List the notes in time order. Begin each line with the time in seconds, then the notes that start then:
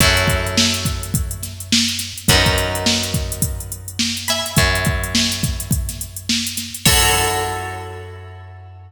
0.00 F#2 E4 F#4 A4 C#5, kick, closed hi-hat
0.17 closed hi-hat
0.28 kick, closed hi-hat
0.47 closed hi-hat
0.58 snare
0.74 closed hi-hat
0.85 kick, closed hi-hat
1.03 closed hi-hat
1.14 kick, closed hi-hat
1.31 closed hi-hat
1.43 snare, closed hi-hat
1.60 closed hi-hat
1.72 snare
1.88 closed hi-hat
1.99 snare, closed hi-hat
2.18 closed hi-hat
2.28 F#2 F#4 A#4 B4, kick, closed hi-hat
2.33 D#4
2.46 kick, snare, closed hi-hat
2.58 closed hi-hat
2.75 closed hi-hat
2.86 snare
3.03 closed hi-hat
3.14 kick, closed hi-hat
3.32 closed hi-hat
3.42 kick, closed hi-hat
3.60 closed hi-hat
3.72 closed hi-hat
3.88 closed hi-hat
3.99 snare
4.17 snare, closed hi-hat
4.28 E5 G#5 B5, snare, closed hi-hat
4.46 snare, closed hi-hat
4.56 F#2, kick, closed hi-hat
4.75 closed hi-hat
4.85 kick, closed hi-hat
5.04 closed hi-hat
5.15 snare
5.32 closed hi-hat
5.43 kick, closed hi-hat
5.60 closed hi-hat
5.71 kick, closed hi-hat
5.89 snare, closed hi-hat
6.01 closed hi-hat
6.16 closed hi-hat
6.29 snare
6.47 closed hi-hat
6.57 snare, closed hi-hat
6.74 closed hi-hat
6.85 F#2 E4 F#4 A4 C#5, kick, crash